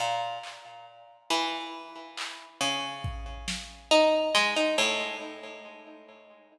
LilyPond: <<
  \new Staff \with { instrumentName = "Harpsichord" } { \time 6/8 \tempo 4. = 46 bes,8 r4 e4. | des4. ees'8 aes16 ees'16 a,8 | }
  \new DrumStaff \with { instrumentName = "Drums" } \drummode { \time 6/8 r8 hc4 r4 hc8 | r8 bd8 sn8 r8 sn4 | }
>>